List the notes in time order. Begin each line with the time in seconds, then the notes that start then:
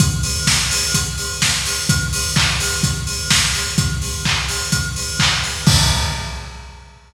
0.00 kick, closed hi-hat
0.23 open hi-hat
0.47 kick, snare
0.71 open hi-hat
0.94 kick, closed hi-hat
1.18 open hi-hat
1.42 kick, snare
1.65 open hi-hat
1.89 kick, closed hi-hat
2.13 open hi-hat
2.36 kick, clap
2.60 open hi-hat
2.83 kick, closed hi-hat
3.07 open hi-hat
3.30 kick, snare
3.54 open hi-hat
3.78 kick, closed hi-hat
4.02 open hi-hat
4.25 kick, clap
4.48 open hi-hat
4.72 kick, closed hi-hat
4.96 open hi-hat
5.19 kick, clap
5.43 open hi-hat
5.67 kick, crash